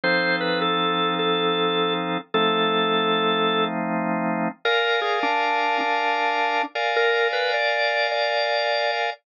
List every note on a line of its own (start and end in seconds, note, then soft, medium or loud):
0.03 2.18 F3 medium
0.03 2.18 C4 medium
0.03 2.18 D#4 medium
0.03 2.18 A4 loud
0.03 0.36 C5 medium
0.41 0.60 B4 medium
0.62 1.14 A4 medium
1.19 1.94 A4 medium
2.34 4.48 F3 medium
2.34 4.48 A3 loud
2.34 4.48 C4 medium
2.34 4.48 D#4 medium
2.34 3.65 A4 medium
4.65 6.62 A#4 loud
4.65 5.00 A#4 medium
4.65 6.62 D5 loud
4.65 6.62 F5 loud
4.65 6.62 G#5 medium
5.01 5.19 G#4 medium
5.23 5.78 D4 medium
5.81 6.63 D4 medium
6.75 9.10 A#4 loud
6.75 9.10 D5 loud
6.75 9.10 F5 loud
6.75 9.10 G#5 loud
6.96 7.28 A#4 medium
7.33 7.52 B4 medium
7.54 8.07 D5 medium
8.12 8.91 D5 medium